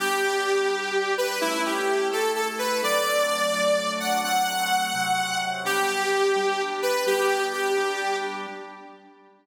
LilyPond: <<
  \new Staff \with { instrumentName = "Lead 2 (sawtooth)" } { \time 6/8 \key g \major \tempo 4. = 85 g'2~ g'8 b'8 | e'8 g'4 a'8 a'16 r16 b'8 | d''2~ d''8 fis''8 | fis''2. |
g'2~ g'8 b'8 | g'4 g'4. r8 | }
  \new Staff \with { instrumentName = "Drawbar Organ" } { \time 6/8 \key g \major <g b d'>4. <g d' g'>4. | <a cis' e'>4. <a e' a'>4. | <fis a c' d'>4. <fis a d' fis'>4. | <fis a c'>4. <c fis c'>4. |
<g b d'>4. <g d' g'>4. | <g b d'>4. <g d' g'>4. | }
>>